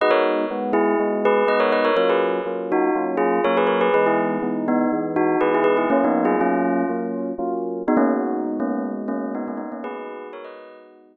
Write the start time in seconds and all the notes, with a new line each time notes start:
0.01 G#3 B3 D#4 F#4 B4 D#5
0.10 A#4 C#5
0.50 G#3 B3 D#4 F#4
0.73 E4 G#4
0.99 G#3 B3 D#4 F#4
1.25 G#4 B4
1.47 G#3 B3 D#4 F#4 B4 D#5
1.60 A#4 C#5
1.72 B4 D#5
1.85 A#4 C#5
1.96 F#3 A#3 C#4 F4 A#4 C#5
2.09 G#4 B4
2.46 F#3 A#3 C#4 F4
2.72 D#4 F#4
2.95 F#3 A#3 C#4 F4
3.17 F4 G#4
3.44 F#3 A#3 C#4 F4 A#4 C#5
3.57 G#4 B4
3.67 A#4 C#5
3.81 G#4 B4
3.94 E3 G#3 B3 D#4 G#4 B4
4.06 E4 G#4
4.42 E3 G#3 B3 D#4
4.68 B3 D#4
4.92 E3 G#3 B3 D#4
5.16 D#4 F#4
5.41 E3 G#3 B3 D#4 G#4 B4
5.54 E4 G#4
5.64 G#4 B4
5.77 E4 G#4
5.90 F#3 A#3 C#4 F4
6.04 B3 D#4
6.25 F4 G#4
6.39 F#3 A#3 C#4 F4
6.89 F#3 A#3 C#4 F4
7.38 F#3 A#3 C#4 F4
7.87 G#3 B3 D#4 F#4
7.97 A#3 C#4
8.60 A#3 C#4
9.08 A#3 C#4
9.35 B3 D#4
9.48 A#3 C#4
9.57 B3 D#4
9.72 A#3 C#4
9.84 G#3 B3 D#4 F#4 G#4 B4
10.33 A#4 C#5
10.44 B4 D#5